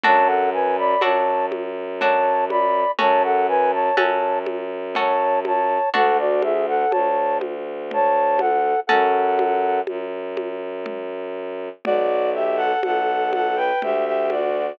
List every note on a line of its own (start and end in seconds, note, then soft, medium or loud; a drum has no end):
0.03 0.94 F#2 loud
0.03 0.93 D4 loud
0.03 0.93 F#4 loud
0.03 0.93 A4 loud
0.03 0.28 C#5 medium
0.03 0.28 A5 medium
0.03 low conga loud
0.27 0.50 A4 medium
0.27 0.50 F#5 medium
0.53 0.76 B4 medium
0.53 0.76 G#5 medium
0.78 1.02 D5 medium
0.78 1.02 B5 medium
1.01 2.84 F#2 medium
1.01 1.90 D4 medium
1.01 1.90 F#4 medium
1.01 1.90 A4 medium
1.01 1.46 C#5 medium
1.01 1.46 A5 medium
1.01 high conga medium
1.52 high conga medium
2.00 2.90 D4 medium
2.00 2.90 F#4 medium
2.00 2.90 A4 medium
2.00 2.45 C#5 medium
2.00 2.45 A5 medium
2.00 low conga medium
2.50 2.91 D5 medium
2.50 2.91 B5 medium
2.50 high conga medium
2.99 3.89 F#2 loud
2.99 3.87 C#4 medium
2.99 3.87 F#4 loud
2.99 3.87 A4 loud
2.99 3.23 C#5 medium
2.99 3.23 A5 medium
2.99 low conga loud
3.24 3.47 A4 medium
3.24 3.47 F#5 medium
3.48 3.71 B4 medium
3.48 3.71 G#5 medium
3.73 3.96 C#5 medium
3.73 3.96 A5 medium
3.97 5.78 F#2 medium
3.97 4.85 C#4 loud
3.97 4.85 F#4 loud
3.97 4.85 A4 loud
3.97 4.39 C#5 medium
3.97 4.39 A5 medium
3.97 high conga medium
4.46 high conga medium
4.95 5.85 C#4 medium
4.95 5.85 F#4 medium
4.95 5.85 A4 medium
4.95 5.40 C#5 medium
4.95 5.40 A5 medium
4.95 low conga medium
5.45 5.89 C#5 medium
5.45 5.89 A5 medium
5.45 high conga medium
5.94 6.84 D2 loud
5.94 8.59 D4 loud
5.94 8.59 F#4 loud
5.94 8.59 A4 loud
5.94 6.18 A4 medium
5.94 6.18 F#5 medium
5.94 low conga medium
6.19 6.42 F#4 medium
6.19 6.42 D5 medium
6.42 6.66 G#4 medium
6.42 6.66 E5 medium
6.42 high conga medium
6.68 6.92 A4 medium
6.68 6.92 F#5 medium
6.91 8.73 D2 medium
6.91 7.38 C#5 medium
6.91 7.38 A5 medium
6.91 high conga medium
7.41 high conga medium
7.91 8.41 C#5 medium
7.91 8.41 A5 medium
7.91 low conga medium
8.39 8.80 A4 medium
8.39 8.80 F#5 medium
8.39 high conga medium
8.87 9.80 F#2 loud
8.87 11.55 C#4 loud
8.87 11.55 F#4 loud
8.87 9.81 A4 medium
8.87 11.55 A4 loud
8.87 9.81 F#5 medium
8.87 low conga medium
9.39 high conga medium
9.87 11.69 F#2 medium
9.87 high conga medium
10.37 high conga medium
10.86 low conga medium
11.85 12.73 B1 loud
11.85 12.30 F#4 medium
11.85 12.30 D5 medium
11.85 low conga loud
12.34 12.57 G4 medium
12.34 12.57 E5 medium
12.56 12.80 A4 medium
12.56 12.80 F#5 medium
12.83 13.71 B1 medium
12.83 13.31 A4 medium
12.83 13.31 F#5 medium
12.83 high conga medium
13.32 13.56 A4 medium
13.32 13.56 F#5 medium
13.32 high conga medium
13.56 13.79 B4 medium
13.56 13.79 G5 medium
13.81 14.71 D2 medium
13.81 14.04 G4 medium
13.81 14.04 E5 medium
13.81 low conga medium
14.05 14.28 G4 medium
14.05 14.28 E5 medium
14.29 14.73 F#4 medium
14.29 14.73 D5 medium
14.29 high conga medium